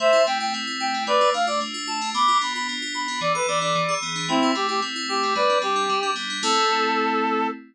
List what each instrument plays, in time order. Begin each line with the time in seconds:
0.00 electric piano 2 A3, clarinet C5 E5
0.13 electric piano 2 E4
0.27 electric piano 2 C4, clarinet G5
0.40 electric piano 2 E4, clarinet G5
0.54 electric piano 2 A3
0.67 electric piano 2 E4
0.80 electric piano 2 E4, clarinet G5
0.94 electric piano 2 C4
1.07 electric piano 2 A3, clarinet B4 D5
1.21 electric piano 2 F4
1.34 electric piano 2 D4, clarinet F5
1.47 electric piano 2 F4, clarinet D5
1.61 electric piano 2 A3
1.74 electric piano 2 F4
1.87 electric piano 2 F4, clarinet A5
2.01 electric piano 2 D4
2.14 electric piano 2 B3, clarinet B5 D6
2.28 electric piano 2 F4
2.41 electric piano 2 D4, clarinet B5
2.55 electric piano 2 F4, clarinet B5
2.69 electric piano 2 B3
2.82 electric piano 2 F4
2.94 electric piano 2 F4, clarinet B5
3.08 electric piano 2 D4
3.21 electric piano 2 E3, clarinet D5
3.35 electric piano 2 A4, clarinet B4
3.48 electric piano 2 B3, clarinet D5
3.61 electric piano 2 D4, clarinet D5
3.75 electric piano 2 E3
3.89 electric piano 2 G#4
4.02 electric piano 2 B3
4.16 electric piano 2 D4
4.28 electric piano 2 A3, clarinet C4 E4
4.43 electric piano 2 E4
4.55 electric piano 2 C4, clarinet G4
4.69 electric piano 2 E4, clarinet G4
4.82 electric piano 2 A3
4.96 electric piano 2 E4
5.09 electric piano 2 E4, clarinet G4
5.23 electric piano 2 C4
5.35 electric piano 2 G3, clarinet B4 D5
5.49 electric piano 2 D4
5.62 electric piano 2 C4, clarinet G4
5.76 electric piano 2 D4
5.89 electric piano 2 G3
6.03 electric piano 2 D4
6.16 electric piano 2 B3
6.30 electric piano 2 D4
6.43 electric piano 2 A3 C4 E4, clarinet A4